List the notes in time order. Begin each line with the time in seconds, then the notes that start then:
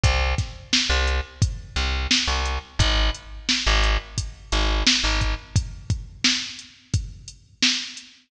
0.04 C2, kick, closed hi-hat
0.38 kick, snare, closed hi-hat
0.73 snare
0.90 C2
1.07 closed hi-hat
1.42 kick, closed hi-hat
1.76 C2, closed hi-hat
2.11 snare
2.28 C2
2.45 closed hi-hat
2.79 G#1, kick, closed hi-hat
3.15 closed hi-hat
3.49 snare
3.67 G#1
3.83 closed hi-hat
4.18 kick, closed hi-hat
4.52 G#1, closed hi-hat
4.87 snare
5.04 G#1
5.21 kick, closed hi-hat
5.56 kick, closed hi-hat
5.90 kick, closed hi-hat
6.24 snare
6.59 closed hi-hat
6.94 kick, closed hi-hat
7.28 closed hi-hat
7.62 snare
7.97 closed hi-hat